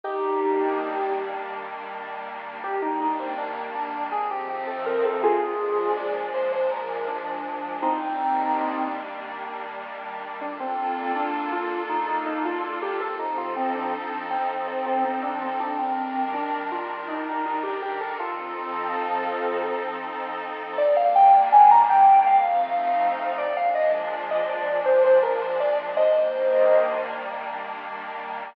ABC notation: X:1
M:7/8
L:1/16
Q:1/4=81
K:Eb
V:1 name="Lead 1 (square)"
[EG]6 z8 | G E E C D z D2 A G G =A B A | [FA]4 d z c c B2 D4 | [CE]6 z8 |
[K:Bb] D C3 D2 F2 E E E F F G | A E F C D3 C z C C C D C | D C3 D2 F2 E E E G G A | [FA]8 z6 |
[K:Eb] d f g2 a b g2 f6 | d f e z2 e d2 c c B c d z | [ce]6 z8 |]
V:2 name="Pad 5 (bowed)"
[E,G,B,D]14 | [E,G,B,D]8 [F,=A,CE]6 | [B,,F,A,D]14 | [E,G,B,D]14 |
[K:Bb] [B,DFA]14 | [F,CEA]14 | [E,G,DB]14 | [F,CEA]14 |
[K:Eb] [E,G,B,D]8 [F,=A,CE]6 | [B,,F,A,D]14 | [E,G,B,D]14 |]